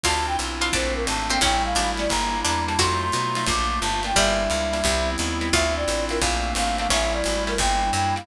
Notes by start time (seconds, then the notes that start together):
0.03 D2 C4 D4 E4 F4 A5, kick, crash, ride
0.27 G5
0.39 B1, hi-hat pedal, ride
0.61 C4 D4 E4 F4, snare, ride
0.72 A#1 A3 A#3 C4 D4 C5, kick, ride
0.95 A#4
1.07 G#1 A5, hi-hat pedal, ride
1.30 A3 A#3 C4 D4 G5, ride
1.41 A1 G3 A3 C#4 E4 G5, kick, ride
1.65 F5
1.75 G#1 D4, hi-hat pedal, ride
1.97 G3 A3 C#4 E4 D5, snare, ride
2.09 G1 G3 A#3 D4 E4 A#5, kick, ride
2.44 E2 D4 A#5, hi-hat pedal, ride
2.67 G3 A#3 D4 E4 A5, ride
2.78 F2 F#3 A3 D#4 F4 F#4 C6, kick, ride
3.02 C6
3.12 B2, hi-hat pedal, ride
3.35 F#3 A3 D#4 F4, snare, ride
3.46 A#1 A3 A#3 D4 F4 D6, kick, ride
3.81 G1 A5, hi-hat pedal, ride
4.03 A3 A#3 D4 F4 G5, ride
4.15 G1 G3 A#3 D4 E4 E5, kick, ride
4.50 C#2, ride
4.73 G3 A#3 D4 E4, snare, ride
4.84 C2 G3 B3 C4 E4, kick, ride
5.18 D#2, hi-hat pedal, ride
5.41 G3 B3 C4 E4, ride
5.53 D2 C4 D4 E4 F4 E5, kick, ride
5.76 D5
5.88 A1, hi-hat pedal, ride
6.09 C4 D4 E4 F4 A#4, snare, ride
6.21 A#1 A3 A#3 C4 D4 F5, kick, ride
6.55 G#1 F5, hi-hat pedal, ride
6.78 A3 A#3 C4 D4 F5, ride
6.89 A1 G3 A3 C#4 E4 E5, kick, ride
7.13 D5
7.24 G#1, hi-hat pedal, ride
7.47 G3 A3 C#4 E4 A#4, snare, ride
7.57 G1 G3 A#3 D4 E4 G5, kick, ride
7.93 F#2 G5, hi-hat pedal, ride
8.15 G3 A#3 D4 E4 F5, ride